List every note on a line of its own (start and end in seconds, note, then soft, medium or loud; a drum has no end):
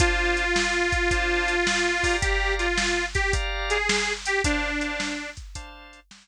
0.00 0.44 D4 loud
0.00 2.16 F4 loud
0.00 0.44 C5 loud
0.00 0.44 F5 loud
0.00 0.44 A5 loud
0.00 kick loud
0.00 closed hi-hat loud
0.37 closed hi-hat medium
0.56 snare medium
0.92 kick medium
0.92 closed hi-hat medium
1.11 1.56 D4 loud
1.11 1.56 C5 loud
1.11 1.56 F5 loud
1.11 1.56 A5 loud
1.11 kick medium
1.11 closed hi-hat medium
1.48 closed hi-hat medium
1.67 snare loud
2.03 2.67 G4 loud
2.03 2.67 D5 loud
2.03 2.67 F5 loud
2.03 2.67 A#5 loud
2.03 kick medium
2.03 open hi-hat medium
2.22 2.54 G4 loud
2.22 kick medium
2.22 closed hi-hat loud
2.59 3.06 F4 loud
2.59 closed hi-hat medium
2.78 snare medium
3.15 3.33 G4 loud
3.15 kick medium
3.15 closed hi-hat medium
3.33 3.78 G4 loud
3.33 3.78 D5 loud
3.33 3.78 F5 loud
3.33 3.78 A#5 loud
3.33 kick medium
3.33 closed hi-hat medium
3.70 4.13 G#4 medium
3.70 closed hi-hat medium
3.89 snare loud
4.25 4.42 G4 loud
4.25 closed hi-hat medium
4.44 4.70 D4 loud
4.44 5.30 D4 loud
4.44 4.70 C5 loud
4.44 4.70 F5 loud
4.44 4.70 A5 loud
4.44 kick medium
4.44 closed hi-hat medium
4.81 5.15 D4 medium
4.81 5.15 C5 medium
4.81 5.15 F5 medium
4.81 5.15 A5 loud
4.81 closed hi-hat medium
5.00 snare medium
5.37 kick medium
5.37 closed hi-hat medium
5.55 6.00 D4 loud
5.55 6.00 C5 loud
5.55 6.00 F5 loud
5.55 6.00 A5 loud
5.55 kick medium
5.55 closed hi-hat loud
5.93 closed hi-hat medium
6.11 snare loud